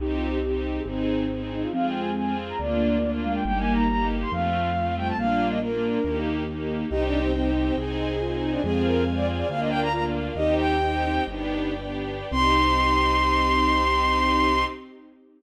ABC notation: X:1
M:4/4
L:1/16
Q:1/4=139
K:Cm
V:1 name="Violin"
(3E2 F2 G2 G2 z A C6 E F | (3f2 g2 a2 a2 z b d6 f g | (3g2 a2 b2 b2 z c' f6 g =a | f3 e B6 z6 |
(3E2 D2 C2 C2 z C A6 E D | A2 B2 z d z d f e g b b z3 | "^rit." e2 g6 z8 | c'16 |]
V:2 name="Ocarina"
[EG]6 z2 E6 E2 | [A,C]6 z2 B,6 A,2 | [G,B,]6 z2 F,6 G,2 | [G,B,]4 B, D5 z6 |
[EG]4 E8 F4 | [A,C]6 z6 F4 | "^rit." [EG]6 E6 z4 | C16 |]
V:3 name="String Ensemble 1"
[CEG]4 [CEG]4 [CEA]4 [CEA]4 | [CFA]4 [CFA]4 [B,DF]4 [B,DF]4 | [B,EG]4 [B,EG]4 [=A,CF]4 [A,CF]4 | [B,DF]4 [B,DF]4 [B,EG]4 [B,EG]4 |
[CEG]4 [CEG]4 [CEA]4 [CEA]4 | [CFA]4 [CFA]4 [B,DF]4 [B,DF]4 | "^rit." [CEG]4 [CEG]4 [=B,DG]4 [B,DG]4 | [CEG]16 |]
V:4 name="Acoustic Grand Piano" clef=bass
C,,8 A,,,8 | F,,8 D,,8 | G,,,8 F,,8 | B,,,8 E,,8 |
C,,8 C,,8 | F,,8 D,,8 | "^rit." E,,8 G,,,8 | C,,16 |]
V:5 name="String Ensemble 1"
[CEG]8 [CEA]8 | [CFA]8 [B,DF]8 | [B,EG]8 [=A,CF]8 | [B,DF]8 [B,EG]8 |
[ceg]8 [cea]8 | [cfa]8 [Bdf]8 | "^rit." [ceg]8 [=Bdg]8 | [CEG]16 |]